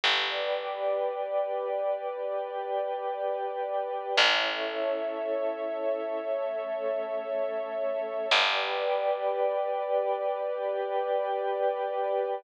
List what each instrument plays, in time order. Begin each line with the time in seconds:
0.03 electric bass (finger) G1, pad 2 (warm) G4 B4 D5, pad 5 (bowed) B4 D5 G5
2.10 pad 5 (bowed) G4 B4 G5
4.17 electric bass (finger) A1, pad 5 (bowed) C#4 E4 A4, pad 2 (warm) A4 C#5 E5
6.25 pad 5 (bowed) A3 C#4 A4
8.31 electric bass (finger) G1, pad 2 (warm) G4 B4 D5, pad 5 (bowed) B4 D5 G5
10.39 pad 5 (bowed) G4 B4 G5